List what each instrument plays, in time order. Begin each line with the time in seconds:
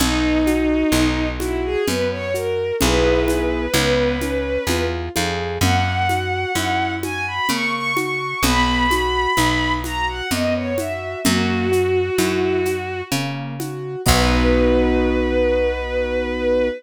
0.00 electric bass (finger) B1, acoustic grand piano B3, violin D#4, low conga, shaker
0.47 acoustic grand piano F#4, high conga, shaker
0.92 electric bass (finger) B1, acoustic grand piano D#4, high conga, shaker
1.40 violin E4, acoustic grand piano F#4, high conga, shaker
1.64 violin G#4
1.87 electric bass (finger) F#2, acoustic grand piano B3, violin B4, low conga, shaker
2.11 violin C#5
2.34 acoustic grand piano F#4, violin A#4, shaker
2.81 electric bass (finger) B1, acoustic grand piano B3 E4 G#4, violin B4, low conga, shaker
3.28 high conga, shaker
3.74 electric bass (finger) C#2, acoustic grand piano B3, high conga, shaker
4.21 acoustic grand piano C#4, high conga, shaker
4.67 electric bass (finger) E2, acoustic grand piano F4, low conga, shaker
5.16 electric bass (finger) F2, acoustic grand piano G#4, high conga, shaker
5.61 electric bass (finger) F#2, acoustic grand piano A#3, violin F#5, low conga, shaker
6.09 acoustic grand piano F#4, high conga, shaker
6.55 electric bass (finger) F#2, acoustic grand piano E4, high conga, shaker
7.03 acoustic grand piano F#4, violin G#5, high conga, shaker
7.27 violin B5
7.49 electric bass (finger) C#3, acoustic grand piano A#3, violin C#6, low conga, shaker
7.73 violin C#6
7.97 acoustic grand piano F#4, violin C#6, high conga, shaker
8.43 electric bass (finger) B1, acoustic grand piano B3, violin B5, low conga, shaker
8.91 acoustic grand piano F#4, high conga, shaker
9.37 electric bass (finger) B1, acoustic grand piano D#4, high conga, shaker
9.84 acoustic grand piano F#4, violin A#5, high conga, shaker
10.08 violin F#5
10.31 electric bass (finger) F#2, acoustic grand piano B3, violin D#5, low conga, shaker
10.54 violin C#5
10.78 acoustic grand piano F#4, violin E5, high conga, shaker
11.24 electric bass (finger) F#2, acoustic grand piano A#3, violin F#4, low conga, shaker
11.72 acoustic grand piano F#4, shaker
12.18 electric bass (finger) F#2, acoustic grand piano E4, high conga, shaker
12.65 acoustic grand piano F#4, high conga, shaker
13.12 electric bass (finger) C#3, acoustic grand piano A#3, low conga, shaker
13.60 acoustic grand piano F#4, high conga, shaker
14.06 electric bass (finger) B1, acoustic grand piano B3 D#4 F#4, violin B4, kick, crash